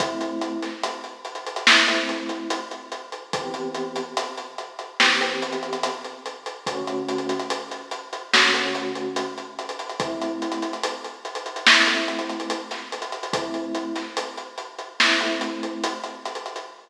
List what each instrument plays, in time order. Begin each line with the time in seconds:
0.00 electric piano 1 A3 C4 E4, kick, closed hi-hat
0.21 closed hi-hat
0.41 closed hi-hat
0.62 snare, closed hi-hat
0.84 closed hi-hat
1.04 closed hi-hat
1.25 closed hi-hat
1.35 closed hi-hat
1.47 closed hi-hat
1.56 closed hi-hat
1.67 electric piano 1 A3 C4 E4, snare
1.87 electric piano 1 A3 C4 E4, closed hi-hat
2.09 closed hi-hat
2.29 closed hi-hat
2.50 closed hi-hat
2.71 closed hi-hat
2.92 closed hi-hat
3.12 closed hi-hat
3.33 electric piano 1 E3 B3 C4 G4, kick, closed hi-hat
3.54 closed hi-hat
3.74 closed hi-hat
3.96 closed hi-hat
4.17 closed hi-hat
4.37 closed hi-hat
4.58 closed hi-hat
4.79 closed hi-hat
5.00 electric piano 1 E3 B3 C4 G4, snare
5.21 electric piano 1 E3 B3 C4 G4, closed hi-hat
5.42 closed hi-hat
5.52 closed hi-hat
5.63 closed hi-hat
5.73 closed hi-hat
5.83 closed hi-hat
6.05 closed hi-hat
6.26 closed hi-hat
6.46 closed hi-hat
6.66 electric piano 1 D3 A3 C#4 F#4, kick, closed hi-hat
6.87 closed hi-hat
7.09 closed hi-hat
7.18 closed hi-hat
7.29 closed hi-hat
7.39 closed hi-hat
7.50 closed hi-hat
7.71 closed hi-hat
7.91 closed hi-hat
8.13 closed hi-hat
8.34 electric piano 1 D3 A3 C#4 F#4, snare
8.54 electric piano 1 D3 A3 C#4 F#4, closed hi-hat
8.75 closed hi-hat
8.95 closed hi-hat
9.16 closed hi-hat
9.38 closed hi-hat
9.59 closed hi-hat
9.69 closed hi-hat
9.79 closed hi-hat
9.89 closed hi-hat
10.00 electric piano 1 A3 C4 E4, kick, closed hi-hat
10.22 closed hi-hat
10.42 closed hi-hat
10.52 closed hi-hat
10.62 closed hi-hat
10.73 closed hi-hat
10.84 closed hi-hat
11.05 closed hi-hat
11.25 closed hi-hat
11.35 closed hi-hat
11.46 closed hi-hat
11.56 closed hi-hat
11.66 electric piano 1 A3 C4 E4, snare
11.87 electric piano 1 A3 C4 E4, closed hi-hat
12.08 closed hi-hat
12.19 closed hi-hat
12.30 closed hi-hat
12.40 closed hi-hat
12.50 closed hi-hat
12.71 snare, closed hi-hat
12.92 closed hi-hat
13.02 closed hi-hat
13.12 closed hi-hat
13.23 closed hi-hat
13.33 electric piano 1 A3 C4 E4, kick, closed hi-hat
13.54 closed hi-hat
13.75 closed hi-hat
13.96 snare, closed hi-hat
14.17 closed hi-hat
14.37 closed hi-hat
14.58 closed hi-hat
14.78 closed hi-hat
15.00 electric piano 1 A3 C4 E4, snare
15.21 electric piano 1 A3 C4 E4, closed hi-hat
15.41 closed hi-hat
15.63 closed hi-hat
15.84 closed hi-hat
16.04 closed hi-hat
16.26 closed hi-hat
16.35 closed hi-hat
16.46 closed hi-hat
16.56 closed hi-hat